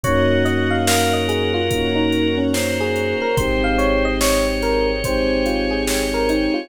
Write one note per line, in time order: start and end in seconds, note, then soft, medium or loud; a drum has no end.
0.03 3.14 F#2 medium
0.03 1.58 A#3 medium
0.03 1.58 C#4 medium
0.03 1.58 D#4 medium
0.03 1.58 F#4 medium
0.03 0.76 F#4 loud
0.03 1.71 A#4 loud
0.03 0.43 C#5 medium
0.03 1.71 C#5 medium
0.03 1.71 D#5 loud
0.03 1.71 F#5 loud
0.03 kick loud
0.03 closed hi-hat loud
0.45 0.70 D#5 medium
0.45 closed hi-hat medium
0.70 0.86 F5 medium
0.87 2.36 A#4 loud
0.87 1.12 F5 loud
0.87 snare loud
1.13 1.28 D#5 medium
1.28 1.53 G#4 medium
1.28 closed hi-hat medium
1.54 1.86 F4 medium
1.70 3.24 A#3 medium
1.70 3.24 C#4 medium
1.70 3.24 D#4 medium
1.70 3.24 F#4 medium
1.70 3.37 A#4 loud
1.70 3.37 C#5 loud
1.70 3.37 F#5 medium
1.70 3.37 A#5 loud
1.70 kick loud
1.70 closed hi-hat loud
1.95 2.27 D#4 loud
2.12 closed hi-hat medium
2.38 2.53 C#4 medium
2.53 2.78 C#4 medium
2.53 3.36 C5 medium
2.53 snare loud
2.80 3.15 G#4 medium
2.96 closed hi-hat medium
3.22 3.37 A#4 medium
3.37 6.47 G#1 medium
3.37 4.91 G#3 medium
3.37 4.91 C4 medium
3.37 4.91 D#4 medium
3.37 4.91 G4 medium
3.37 5.02 G#4 loud
3.37 5.02 C5 medium
3.37 4.14 C5 loud
3.37 3.62 C5 medium
3.37 5.02 D#5 loud
3.37 5.02 G5 medium
3.37 kick loud
3.37 closed hi-hat loud
3.64 3.79 F5 medium
3.78 4.03 C#5 medium
3.78 closed hi-hat medium
4.05 4.20 D#5 medium
4.21 4.45 C#5 medium
4.21 5.83 C#5 medium
4.21 snare loud
4.62 4.87 A#4 loud
4.62 snare soft
4.62 closed hi-hat medium
5.03 6.59 G#3 medium
5.03 6.59 C4 medium
5.03 6.59 D#4 medium
5.03 6.59 G4 medium
5.03 6.69 G#4 loud
5.03 6.69 C5 medium
5.03 5.46 C5 medium
5.03 6.69 G5 loud
5.03 6.69 G#5 loud
5.03 kick loud
5.03 closed hi-hat loud
5.46 5.70 F4 medium
5.46 closed hi-hat medium
5.71 6.04 G#4 medium
5.87 6.69 C#5 medium
5.87 snare loud
6.14 6.29 A#4 medium
6.29 6.54 D#4 medium
6.29 closed hi-hat medium
6.54 6.69 F4 medium